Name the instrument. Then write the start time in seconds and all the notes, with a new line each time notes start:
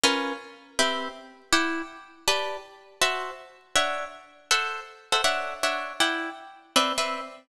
acoustic guitar (steel)
0.03 C#4 F4 A#4 B4
0.79 C4 G4 B4 E5
1.52 E4 D5 F#5 G5
2.28 G4 B4 D5 A5
3.01 F#4 C5 E5 A5
3.76 D4 C#5 E5 F#5
4.51 A4 C5 E5 F#5
5.12 A4 C5 E5 F#5
5.24 D4 C#5 E5 F#5
5.63 D4 C#5 E5 F#5
6.00 E4 D5 F#5 G5
6.76 C4 B4 D5 E5
6.98 C4 B4 D5 E5